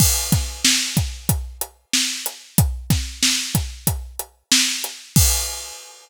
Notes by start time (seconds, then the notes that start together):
0.00 kick, crash
0.32 kick, snare, closed hi-hat
0.65 snare
0.97 kick, closed hi-hat
1.29 kick, closed hi-hat
1.61 closed hi-hat
1.93 snare
2.26 closed hi-hat
2.58 kick, closed hi-hat
2.90 kick, snare, closed hi-hat
3.23 snare
3.55 kick, closed hi-hat
3.87 kick, closed hi-hat
4.19 closed hi-hat
4.52 snare
4.84 closed hi-hat
5.16 kick, crash